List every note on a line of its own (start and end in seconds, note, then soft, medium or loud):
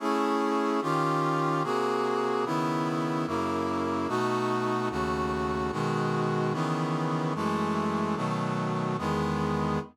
0.00 0.80 A3 medium
0.00 0.80 C#4 medium
0.00 0.80 E4 medium
0.00 0.80 G#4 medium
0.82 1.63 D#3 loud
0.82 1.63 C#4 medium
0.82 1.63 F4 loud
0.82 1.63 G4 medium
1.64 2.44 C3 medium
1.64 2.44 A#3 medium
1.64 2.44 F#4 medium
1.64 2.44 G#4 medium
2.45 3.26 C#3 medium
2.45 3.26 D#3 medium
2.45 3.26 B3 loud
2.45 3.26 E4 medium
3.27 4.08 F#2 medium
3.27 4.08 C#3 medium
3.27 4.08 A#3 loud
3.27 4.08 E4 medium
4.08 4.89 B2 medium
4.08 4.89 A3 loud
4.08 4.89 D#4 medium
4.08 4.89 F#4 loud
4.90 5.71 D#2 medium
4.90 5.71 C#3 medium
4.90 5.71 A3 medium
4.90 5.71 F#4 medium
5.72 6.53 B2 medium
5.72 6.52 D#3 loud
5.72 6.53 G#3 medium
5.72 6.53 F#4 medium
6.53 7.34 C#3 medium
6.53 7.34 D#3 loud
6.53 7.34 E3 medium
6.53 7.34 B3 medium
7.35 8.16 F#2 medium
7.35 8.16 E3 medium
7.35 8.16 G#3 loud
7.35 8.15 A3 loud
8.16 8.97 B2 medium
8.16 8.97 D#3 medium
8.16 8.97 F#3 loud
8.16 8.97 A3 medium
8.98 9.79 E2 medium
8.98 9.79 D#3 medium
8.98 9.79 G#3 loud
8.98 9.79 B3 loud